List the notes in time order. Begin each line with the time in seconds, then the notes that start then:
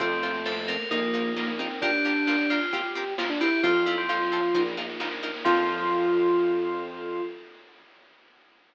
0.00 F2 A3 C4 F4 A4, kick, snare
0.11 snare
0.23 C4 F4 A4, snare
0.34 snare
0.45 C4 F4 A4 C5, snare
0.57 snare
0.68 C4 F4 A4 A#4, snare
0.80 snare
0.91 A#1 A#3 D#4 F4 A#4, kick, snare
1.02 snare
1.14 D#4 F4 A#4, snare
1.25 snare
1.36 A#3 D#4 F4 A#4, snare
1.48 A#3, snare
1.59 C4 D#4 F4 A#4, snare
1.70 snare
1.82 D4 F4 G4 A#4, kick, snare
1.93 snare
2.05 D4 F4 G4 A#4, snare
2.16 snare
2.27 D4 F4 G4 A#4, snare
2.39 snare
2.50 D4 F4 G4 A#4, snare
2.61 snare
2.73 C4 F4 G4 A#4, kick, snare
2.84 snare
2.95 C4 F4 G4 A#4, snare
3.07 snare
3.18 C4 F4 G4 A#4, snare
3.30 D4, snare
3.41 C4 E4 F4 G4 A#4, snare
3.52 snare
3.63 F2 C4 F4 A4 C5, kick, snare
3.75 snare
3.86 C4 E4 F4 A4, snare
3.98 C4, snare
4.09 F3 C4 F4 A4 C5, snare
4.20 snare
4.32 C4 F4 A4, snare
4.43 snare
4.54 A#1 D#4 F4 A#4, kick, snare
4.66 snare
4.77 D#4 F4 A#4, snare
4.89 snare
5.00 A#3 D#4 F4 A#4, snare
5.11 snare
5.23 D#4 F4 A#4, snare
5.34 snare
5.45 F2 F3 C4 F4 A4, kick, crash